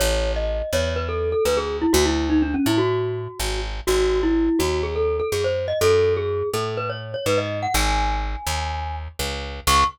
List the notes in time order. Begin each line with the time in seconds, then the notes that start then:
0.00 A1 C#5
0.36 D#5
0.73 E2 C#5
0.96 B4
1.09 A4
1.32 A4
1.45 D2 B4
1.57 G#4
1.82 E4
1.93 D2 F#4
2.05 E4
2.30 D#4
2.42 D4
2.54 C#4
2.66 A2 E4
2.78 F#4
3.40 G#1
3.87 G#1 F#4
4.23 E4
4.59 D#2 F#4
4.83 G#4
4.96 A4
5.20 A4
5.32 F#2 G#4
5.44 C5
5.68 D#5
5.81 F#2 A4
6.17 G#4
6.54 A2 A4
6.77 B4
6.90 C#5
7.14 C#5
7.26 G#2 B4
7.38 D#5
7.63 F#5
7.74 G#1 G#5
8.47 D#2
9.19 C#2
9.67 C#2 C#6